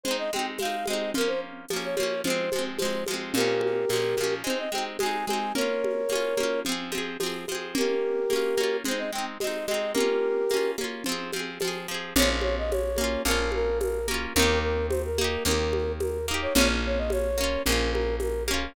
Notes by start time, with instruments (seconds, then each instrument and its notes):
0.04 acoustic guitar (steel) G#3, flute C5, low conga
0.08 acoustic guitar (steel) C4 D#4
0.18 flute D#5
0.33 acoustic guitar (steel) G#3 C4, flute G5, high conga
0.39 acoustic guitar (steel) D#4
0.58 acoustic guitar (steel) G#3, flute F5, tambourine, high conga
0.62 acoustic guitar (steel) C4 D#4
0.86 acoustic guitar (steel) G#3, flute D#5, high conga
0.90 acoustic guitar (steel) C4 D#4
1.14 acoustic guitar (steel) F3 A#3, flute A#4, low conga
1.21 acoustic guitar (steel) C#4
1.27 flute C5
1.68 acoustic guitar (steel) F3, tambourine, high conga
1.73 acoustic guitar (steel) A#3 C#4
1.84 flute C#5
1.96 acoustic guitar (steel) F3 A#3, flute C#5, high conga
2.03 acoustic guitar (steel) C#4
2.24 acoustic guitar (steel) F3 G#3, flute C5, low conga
2.30 acoustic guitar (steel) C4
2.52 acoustic guitar (steel) F3 G#3, high conga
2.59 acoustic guitar (steel) C4
2.79 acoustic guitar (steel) F3 G#3, flute C5, tambourine, high conga
2.85 acoustic guitar (steel) C4
3.06 acoustic guitar (steel) F3, high conga
3.11 acoustic guitar (steel) G#3 C4
3.34 acoustic guitar (steel) A#2 F3, flute G4 A#4, low conga
3.40 acoustic guitar (steel) C#4
3.61 high conga
3.89 acoustic guitar (steel) A#2 F3, tambourine, high conga
3.96 acoustic guitar (steel) C#4
4.17 acoustic guitar (steel) A#2 F3, high conga
4.24 acoustic guitar (steel) C#4
4.44 acoustic guitar (steel) G#3 C4, flute C5, low conga
4.50 acoustic guitar (steel) D#4
4.58 flute D#5
4.72 acoustic guitar (steel) G#3 C4, flute G5, high conga
4.78 acoustic guitar (steel) D#4
4.99 acoustic guitar (steel) G#3 C4, flute G#5, tambourine, high conga
5.06 acoustic guitar (steel) D#4
5.26 acoustic guitar (steel) G#3, flute G#5, high conga
5.30 acoustic guitar (steel) C4 D#4
5.55 acoustic guitar (steel) A#3 C#4, flute A#4 C#5, low conga
5.61 acoustic guitar (steel) F4
5.84 high conga
6.09 acoustic guitar (steel) A#3 C#4, tambourine, high conga
6.15 acoustic guitar (steel) F4
6.37 acoustic guitar (steel) A#3 C#4, high conga
6.43 acoustic guitar (steel) F4
6.65 acoustic guitar (steel) F3 C4, low conga
6.72 acoustic guitar (steel) G#4
6.92 acoustic guitar (steel) F3 C4, high conga
6.98 acoustic guitar (steel) G#4
7.20 acoustic guitar (steel) F3 C4, tambourine, high conga
7.26 acoustic guitar (steel) G#4
7.48 acoustic guitar (steel) F3 C4, high conga
7.55 acoustic guitar (steel) G#4
7.75 acoustic guitar (steel) A#3 C#4, flute G4 A#4, low conga
7.81 acoustic guitar (steel) F4
8.30 acoustic guitar (steel) A#3 C#4, tambourine, high conga
8.36 acoustic guitar (steel) F4
8.57 acoustic guitar (steel) A#3 C#4, high conga
8.64 acoustic guitar (steel) F4
8.85 acoustic guitar (steel) G#3 C4, flute C5, low conga
8.91 acoustic guitar (steel) D#4
8.98 flute D#5
9.12 acoustic guitar (steel) G#3 C4, flute G5
9.18 acoustic guitar (steel) D#4
9.40 acoustic guitar (steel) G#3 C4, flute D#5, tambourine, high conga
9.47 acoustic guitar (steel) D#4
9.66 acoustic guitar (steel) G#3, flute D#5, high conga
9.71 acoustic guitar (steel) C4 D#4
9.94 acoustic guitar (steel) A#3 C#4, flute G4 A#4, low conga
10.00 acoustic guitar (steel) F4
10.50 acoustic guitar (steel) A#3, tambourine, high conga
10.54 acoustic guitar (steel) C#4 F4
10.78 acoustic guitar (steel) A#3 C#4, high conga
10.84 acoustic guitar (steel) F4
11.04 acoustic guitar (steel) F3, low conga
11.09 acoustic guitar (steel) C4 G#4
11.33 acoustic guitar (steel) F3 C4, high conga
11.39 acoustic guitar (steel) G#4
11.60 acoustic guitar (steel) F3, tambourine, high conga
11.65 acoustic guitar (steel) C4 G#4
11.88 acoustic guitar (steel) F3 C4
11.94 acoustic guitar (steel) G#4
12.16 electric bass (finger) A#1, acoustic guitar (steel) A#3 C#4, flute C#5, low conga
12.22 acoustic guitar (steel) F4
12.41 flute C#5, high conga
12.58 flute D#5
12.71 flute C#5, tambourine, high conga
12.96 acoustic guitar (steel) A#3, high conga
13.01 acoustic guitar (steel) C#4 F4
13.25 electric bass (finger) A#1, acoustic guitar (steel) A#3 C#4, flute A#4, low conga
13.31 acoustic guitar (steel) F4
13.52 flute A#4, high conga
13.81 flute A#4, tambourine, high conga
14.08 acoustic guitar (steel) A#3 C#4, high conga
14.14 acoustic guitar (steel) F4
14.35 electric bass (finger) D#2, acoustic guitar (steel) A#3, flute A#4, low conga
14.39 acoustic guitar (steel) D#4 G4
14.62 flute A#4
14.89 flute C5, tambourine, high conga
15.05 flute A#4
15.18 acoustic guitar (steel) A#3 D#4, high conga
15.24 acoustic guitar (steel) G4
15.45 electric bass (finger) D#2, acoustic guitar (steel) A#3 D#4, flute A#4, low conga
15.51 acoustic guitar (steel) G4
15.73 high conga
16.00 flute A#4, tambourine, high conga
16.28 acoustic guitar (steel) A#3 D#4
16.34 acoustic guitar (steel) G4
16.42 flute C#5
16.54 electric bass (finger) A#1, acoustic guitar (steel) A#3 C#4, flute C#5, low conga
16.61 acoustic guitar (steel) F4
16.86 flute C#5
16.98 flute D#5
17.10 flute C#5, tambourine, high conga
17.38 acoustic guitar (steel) A#3 C#4
17.44 acoustic guitar (steel) F4
17.66 electric bass (finger) A#1, acoustic guitar (steel) A#3 C#4, flute A#4, low conga
17.72 acoustic guitar (steel) F4
17.92 flute A#4, high conga
18.20 flute A#4, tambourine, high conga
18.48 acoustic guitar (steel) A#3 C#4, high conga
18.54 acoustic guitar (steel) F4